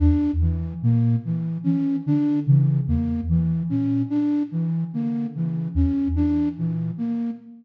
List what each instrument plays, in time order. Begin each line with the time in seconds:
0.00 ocarina E2, flute D4
0.41 flute E3, ocarina E3
0.82 ocarina A#2, flute A#3
1.25 flute E3
1.64 ocarina E3, flute C#4
2.06 ocarina D3, flute D4
2.47 ocarina C#3, flute E3
2.88 ocarina E2, flute A#3
3.29 ocarina E3, flute E3
3.70 ocarina A#2, flute C#4
4.10 flute D4
4.51 flute E3, ocarina E3
4.93 ocarina D3, flute A#3
5.35 ocarina C#3, flute E3
5.75 ocarina E2, flute C#4
6.16 ocarina E3, flute D4
6.57 ocarina A#2, flute E3
6.98 flute A#3